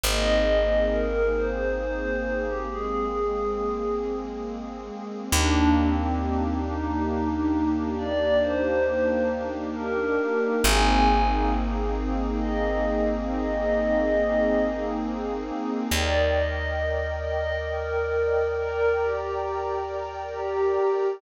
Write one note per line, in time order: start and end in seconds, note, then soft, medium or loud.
0.03 4.91 G#1 medium
0.03 2.66 A#3 medium
0.03 2.66 C4 medium
0.03 2.66 D#4 medium
0.03 2.66 G#4 loud
0.03 0.86 D#5 medium
0.92 1.33 A#4 medium
1.36 1.75 C5 medium
1.81 2.44 C5 medium
2.47 2.67 G4 medium
2.68 5.31 G#3 medium
2.68 5.31 A#3 medium
2.68 5.31 C4 medium
2.68 3.95 G#4 medium
2.68 5.31 G#4 medium
5.32 10.19 D#2 medium
5.32 10.58 A#3 loud
5.32 5.76 D4 loud
5.32 10.58 D4 loud
5.32 10.58 D#4 loud
5.32 10.58 G4 loud
5.78 6.53 C4 medium
6.66 7.73 D#4 medium
7.98 8.38 D5 loud
8.42 9.21 C5 medium
9.75 10.53 A#4 medium
10.63 15.51 G#1 medium
10.63 15.87 A#3 loud
10.63 15.87 C4 loud
10.63 15.87 D#4 loud
10.63 15.87 G#4 loud
10.63 11.21 G#5 medium
12.39 13.15 D#5 medium
13.28 14.55 D#5 loud
15.91 20.78 D#2 medium
15.91 18.54 A#4 loud
15.91 16.32 D5 medium
15.91 18.54 D5 loud
15.91 18.54 D#5 loud
15.91 18.54 G5 medium
16.36 17.07 D#5 medium
17.25 17.60 D#5 medium
17.69 18.54 A#4 medium
18.57 18.95 A#4 loud
18.57 21.19 A#4 medium
18.57 21.19 D5 loud
18.57 21.19 G5 medium
18.57 21.19 A#5 loud
19.01 19.83 G4 medium
20.33 21.06 G4 medium